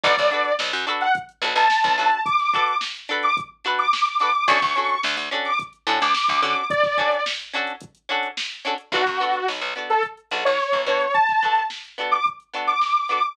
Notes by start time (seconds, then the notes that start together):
0.03 B1 D4 F#4 A4 B4 D5, kick, closed hi-hat
0.17 B1, kick, snare, closed hi-hat
0.31 D4 F#4 A4 B4, closed hi-hat
0.45 closed hi-hat
0.59 B1, snare
0.73 F#2, closed hi-hat
0.87 D4 F#4 A4 B4, closed hi-hat
1.01 F#5, closed hi-hat
1.15 kick, closed hi-hat
1.29 closed hi-hat
1.42 B1 D4 F#4 A4 B4, closed hi-hat
1.55 B1 A5, closed hi-hat
1.70 snare
1.84 B1, kick, snare, closed hi-hat
1.98 B1 D4 F#4 A4 B4 A5, closed hi-hat
2.11 closed hi-hat
2.25 D6, kick, closed hi-hat
2.39 snare, closed hi-hat
2.53 D4 F#4 A4 B4, kick, closed hi-hat
2.68 closed hi-hat
2.81 snare
2.94 closed hi-hat
3.09 D4 F#4 A4 B4, closed hi-hat
3.23 D6, closed hi-hat
3.37 kick, closed hi-hat
3.64 D4 F#4 A4 B4, snare, closed hi-hat
3.79 D6, closed hi-hat
3.93 snare
4.06 closed hi-hat
4.20 D4 F#4 A4 B4 D6, snare, closed hi-hat
4.35 closed hi-hat
4.48 D2 C#4 D4 F#4 A4 C#6, kick, closed hi-hat
4.62 D2, kick, snare, closed hi-hat
4.75 C#4 D4 F#4 A4, snare, closed hi-hat
4.89 closed hi-hat
5.03 D2, snare
5.17 D2, closed hi-hat
5.31 C#4 D4 F#4 A4, closed hi-hat
5.45 D6, snare, closed hi-hat
5.59 kick, closed hi-hat
5.73 closed hi-hat
5.87 A2 C#4 D4 F#4 A4, snare, closed hi-hat
6.00 D2 D6, closed hi-hat
6.14 snare
6.28 D2, kick, closed hi-hat
6.42 D3 C#4 D4 F#4 A4 D6, closed hi-hat
6.56 closed hi-hat
6.70 D5, kick, closed hi-hat
6.83 kick, snare, closed hi-hat
6.98 C#4 D4 F#4 A4, kick, closed hi-hat
7.12 closed hi-hat
7.25 snare, closed hi-hat
7.40 closed hi-hat
7.53 C#4 D4 F#4 A4, closed hi-hat
7.67 closed hi-hat
7.81 kick, closed hi-hat
7.95 closed hi-hat
8.09 C#4 D4 F#4 A4, closed hi-hat
8.23 closed hi-hat
8.37 snare
8.51 closed hi-hat
8.65 C#4 D4 F#4 A4, closed hi-hat
8.78 closed hi-hat
8.92 B1 B3 D4 F#4 A4, kick, closed hi-hat
9.06 F#2, kick, snare, closed hi-hat
9.20 B3 D4 F#4 A4, closed hi-hat
9.33 closed hi-hat
9.48 B1, snare
9.61 B1, snare, closed hi-hat
9.75 B3 D4 F#4 A4, snare, closed hi-hat
9.90 A4, closed hi-hat
10.03 kick, closed hi-hat
10.17 closed hi-hat
10.31 B1 B3 D4 F#4 A4, closed hi-hat
10.45 B1 C#5, closed hi-hat
10.60 snare
10.73 B1, kick, closed hi-hat
10.86 B2 B3 D4 F#4 A4 C#5, closed hi-hat
11.00 closed hi-hat
11.14 A5, kick, closed hi-hat
11.28 kick, snare, closed hi-hat
11.42 B3 D4 F#4 A4, kick, closed hi-hat
11.55 snare, closed hi-hat
11.70 snare
11.85 closed hi-hat
11.98 B3 D4 F#4 A4, closed hi-hat
12.11 D6, closed hi-hat
12.25 kick, closed hi-hat
12.40 closed hi-hat
12.53 B3 D4 F#4 A4, snare, closed hi-hat
12.67 D6, closed hi-hat
12.81 snare
12.95 closed hi-hat
13.08 B3 D4 F#4 A4 D6, closed hi-hat
13.23 closed hi-hat